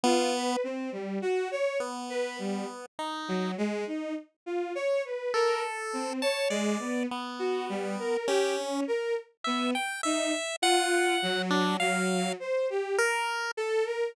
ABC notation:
X:1
M:6/8
L:1/16
Q:3/8=34
K:none
V:1 name="Violin"
F B C G, _G _d z B =G, z2 _G, | _A, _E z F _d B _B z C d A, =B, | z _G =G, _B =G _D B z =B, z _E z | F2 _G,2 G,2 c =G z2 A _B |]
V:2 name="Lead 1 (square)"
B,2 z4 B,4 _E2 | z6 A3 a d2 | B,4 _D2 z2 e g e2 | _g3 D f2 z2 _B2 z2 |]